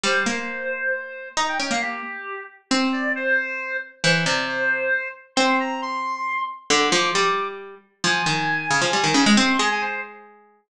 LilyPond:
<<
  \new Staff \with { instrumentName = "Clarinet" } { \time 6/8 \key f \minor \tempo 4. = 90 c''2. | bes''16 g''16 g''16 f''16 g'4. r8 | \key f \major c''8 d''8 c''4. r8 | c''8 d''8 c''4. r8 |
c'''8 bes''8 c'''4. r8 | d'''8 d'''4. r4 | \key f \minor aes''2. | c'''8 aes''16 aes''16 c''8 r4. | }
  \new Staff \with { instrumentName = "Harpsichord" } { \time 6/8 \key f \minor g8 bes2~ bes8 | ees'8 des'16 bes8. r4. | \key f \major c'2. | e8 c4. r4 |
c'2. | d8 f8 g4. r8 | \key f \minor f8 ees4 des16 f16 g16 ees16 des16 aes16 | c'8 aes2~ aes8 | }
>>